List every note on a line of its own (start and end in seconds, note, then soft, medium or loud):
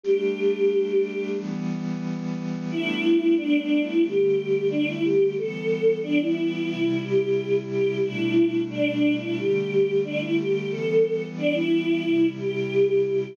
0.03 1.36 G3 medium
0.03 1.36 A3 medium
0.03 1.36 D4 medium
0.03 1.28 G4 medium
1.37 2.69 E3 medium
1.37 2.69 G3 medium
1.37 2.69 B3 medium
2.70 4.02 G3 medium
2.70 4.02 A3 medium
2.70 4.02 B3 medium
2.70 4.02 D4 medium
2.70 3.34 E4 medium
3.37 3.58 D4 medium
3.59 3.80 D4 medium
3.82 4.03 E4 medium
4.03 5.36 D3 medium
4.03 5.36 G3 medium
4.03 5.36 A3 medium
4.03 4.67 G4 medium
4.70 4.86 D4 medium
4.87 5.03 E4 medium
5.04 5.35 G4 medium
5.37 6.69 E3 medium
5.37 6.69 G3 medium
5.37 6.69 B3 medium
5.37 5.99 A4 medium
6.03 6.19 D4 medium
6.21 7.00 E4 medium
6.70 8.02 C3 medium
6.70 8.02 G3 medium
6.70 8.02 E4 medium
7.03 7.56 G4 medium
7.71 7.98 G4 medium
8.04 9.36 B2 medium
8.04 9.36 G3 medium
8.04 9.36 A3 medium
8.04 9.36 D4 medium
8.04 8.60 E4 medium
8.70 8.91 D4 medium
8.92 9.13 D4 medium
9.15 9.37 E4 medium
9.37 10.69 D3 medium
9.37 10.69 G3 medium
9.37 10.69 A3 medium
9.37 10.00 G4 medium
10.04 10.19 D4 medium
10.20 10.36 E4 medium
10.37 10.69 G4 medium
10.70 12.02 E3 medium
10.70 12.02 G3 medium
10.70 12.02 B3 medium
10.70 11.24 A4 medium
11.37 11.53 D4 medium
11.54 12.27 E4 medium
12.04 13.36 C3 medium
12.04 13.36 G3 medium
12.04 13.36 E4 medium
12.37 13.01 G4 medium
13.04 13.34 G4 medium